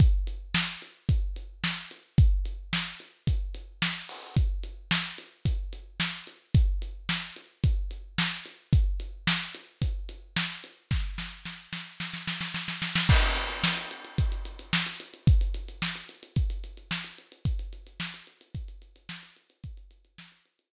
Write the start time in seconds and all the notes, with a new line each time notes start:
0.00 kick, closed hi-hat
0.27 closed hi-hat
0.54 snare
0.82 closed hi-hat
1.09 kick, closed hi-hat
1.36 closed hi-hat
1.64 snare
1.91 closed hi-hat
2.18 kick, closed hi-hat
2.45 closed hi-hat
2.73 snare
3.00 closed hi-hat
3.27 kick, closed hi-hat
3.54 closed hi-hat
3.82 snare
4.09 open hi-hat
4.36 kick, closed hi-hat
4.63 closed hi-hat
4.91 snare
5.18 closed hi-hat
5.45 kick, closed hi-hat
5.73 closed hi-hat
6.00 snare
6.27 closed hi-hat
6.55 kick, closed hi-hat
6.82 closed hi-hat
7.09 snare
7.36 closed hi-hat
7.64 kick, closed hi-hat
7.91 closed hi-hat
8.18 snare
8.45 closed hi-hat
8.73 kick, closed hi-hat
9.00 closed hi-hat
9.27 snare
9.55 closed hi-hat
9.82 kick, closed hi-hat
10.09 closed hi-hat
10.36 snare
10.64 closed hi-hat
10.91 kick, snare
11.18 snare
11.45 snare
11.73 snare
12.00 snare
12.14 snare
12.28 snare
12.41 snare
12.54 snare
12.68 snare
12.82 snare
12.95 snare
13.09 kick, crash
13.23 closed hi-hat
13.36 closed hi-hat
13.50 closed hi-hat
13.64 snare
13.77 closed hi-hat
13.91 closed hi-hat
14.05 closed hi-hat
14.18 kick, closed hi-hat
14.32 closed hi-hat
14.45 closed hi-hat
14.59 closed hi-hat
14.73 snare
14.86 closed hi-hat
15.00 closed hi-hat
15.14 closed hi-hat
15.27 kick, closed hi-hat
15.41 closed hi-hat
15.54 closed hi-hat
15.68 closed hi-hat
15.82 snare
15.95 closed hi-hat
16.09 closed hi-hat
16.23 closed hi-hat
16.36 kick, closed hi-hat
16.50 closed hi-hat
16.64 closed hi-hat
16.77 closed hi-hat
16.91 snare
17.04 closed hi-hat
17.18 closed hi-hat
17.32 closed hi-hat
17.45 kick, closed hi-hat
17.59 closed hi-hat
17.73 closed hi-hat
17.87 closed hi-hat
18.00 snare
18.14 closed hi-hat
18.27 closed hi-hat
18.41 closed hi-hat
18.55 kick, closed hi-hat
18.68 closed hi-hat
18.82 closed hi-hat
18.96 closed hi-hat
19.09 snare
19.23 closed hi-hat
19.36 closed hi-hat
19.50 closed hi-hat
19.64 kick, closed hi-hat
19.77 closed hi-hat
19.91 closed hi-hat
20.05 closed hi-hat
20.18 snare
20.32 closed hi-hat
20.45 closed hi-hat
20.59 closed hi-hat